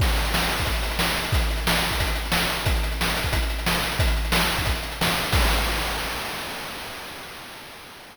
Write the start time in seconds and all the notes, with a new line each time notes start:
0.00 kick, crash
0.07 closed hi-hat
0.17 closed hi-hat
0.25 closed hi-hat
0.34 snare
0.41 closed hi-hat
0.49 closed hi-hat
0.58 kick, closed hi-hat
0.66 kick, closed hi-hat
0.75 closed hi-hat
0.83 closed hi-hat
0.91 closed hi-hat
0.99 snare
1.09 closed hi-hat
1.16 closed hi-hat
1.24 closed hi-hat
1.32 kick, closed hi-hat
1.42 closed hi-hat
1.51 closed hi-hat
1.57 closed hi-hat
1.67 snare
1.74 closed hi-hat
1.83 closed hi-hat
1.91 kick, closed hi-hat
2.00 kick, closed hi-hat
2.07 closed hi-hat
2.15 closed hi-hat
2.25 closed hi-hat
2.32 snare
2.41 closed hi-hat
2.49 closed hi-hat
2.59 closed hi-hat
2.66 kick, closed hi-hat
2.76 closed hi-hat
2.83 closed hi-hat
2.91 closed hi-hat
3.01 snare
3.08 closed hi-hat
3.17 closed hi-hat
3.24 kick, closed hi-hat
3.33 kick, closed hi-hat
3.42 closed hi-hat
3.50 closed hi-hat
3.59 closed hi-hat
3.66 snare
3.76 closed hi-hat
3.84 closed hi-hat
3.92 closed hi-hat
3.99 kick, closed hi-hat
4.08 closed hi-hat
4.17 closed hi-hat
4.25 closed hi-hat
4.32 snare
4.41 closed hi-hat
4.50 closed hi-hat
4.58 kick, closed hi-hat
4.65 kick, closed hi-hat
4.75 closed hi-hat
4.83 closed hi-hat
4.91 closed hi-hat
5.01 snare
5.10 closed hi-hat
5.18 closed hi-hat
5.23 closed hi-hat
5.32 kick, crash